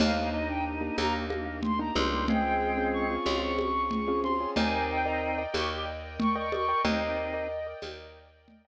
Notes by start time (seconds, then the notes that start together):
0.00 D#2 A#3 D4 D#4 G4 F5, crash, low conga
0.33 D#4 D#5
0.49 A#3 D4 D#4 G4 G5
0.81 A#3 D4 D#4 G4
0.98 D#2 A#3 A#5, tambourine, high conga
1.30 A#3, high conga
1.45 A#3
1.63 C6, low conga
1.79 A#3 D4 D#4 G4 A#5
1.95 C#2 G3 A#3 D4 D#4 G4 C6, high conga
2.12 A#3 D4 D#4 G4
2.28 G#3 C4 C#4 F4 G#4 G5, low conga
2.77 C4 C#4 F4 G#4
2.93 C#6
3.10 C4 C#4 F4 G#4
3.26 C#2 F4, tambourine, high conga
3.42 C#6
3.58 C#6, high conga
3.91 low conga
4.08 C4 C#4 F4 G#4
4.24 C4 C#4 F4 G#4 C6, high conga
4.40 C4 C#4 F4 G#4
4.56 D#2 C4 D#4 A#4 D5 D#5 G5 G#5, low conga
4.90 G5
5.05 A#4 D5 D#5 G5 A#5
5.38 A#4 D5 D#5 G5
5.53 D#2 G4 C#6, tambourine, high conga
6.20 C#6, low conga
6.36 A#4 D5 D#5 G5 C#6
6.52 A#4 D5 D#5 G5 C#6, high conga
6.68 A#4 D5 D#5 G5
6.84 D#2 C4 D#4 A#4 D5 D#5 G5, low conga
7.33 A#4 D5 D#5 G5
7.67 A#4 D5 D#5 G5
7.82 D#2, tambourine, high conga
8.48 low conga
8.65 A#4 D5 D#5 G5